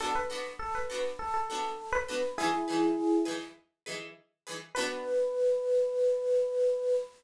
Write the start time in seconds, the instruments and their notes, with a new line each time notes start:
0.00 pizzicato strings B3 D4 F#4 A4, electric piano 1 A4
0.15 electric piano 1 B4
0.30 pizzicato strings B3 D4 F#4 A4
0.59 electric piano 1 A4
0.75 electric piano 1 B4
0.90 pizzicato strings B3 D4 F#4 A4
1.19 electric piano 1 A4
1.34 electric piano 1 A4
1.50 pizzicato strings B3 D4 F#4 A4
1.92 electric piano 1 B4
2.08 pizzicato strings B3 D4 F#4 A4
2.38 pizzicato strings E3 D#4 G#4 B4, electric piano 1 E4 G#4
2.68 pizzicato strings E3 D#4 G#4 B4
3.25 pizzicato strings E3 D#4 G#4 B4
3.86 pizzicato strings E3 D#4 G#4 B4
4.47 pizzicato strings E3 D#4 G#4 B4
4.75 pizzicato strings B3 D4 F#4 A4, electric piano 1 B4